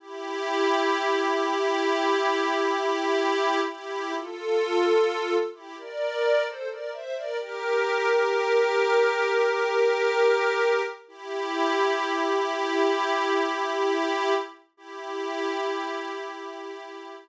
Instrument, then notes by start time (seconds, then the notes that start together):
pad 5 (bowed)
0.00 E4 G4
3.69 E4 G4
4.15 F4 A4
5.54 E4 G4
5.77 A#4 D5
6.46 A4 C5
6.69 A#4 D5
6.92 C5 E5
7.16 A#4 D5
7.38 G4 A#4
11.08 E4 G4
14.77 E4 G4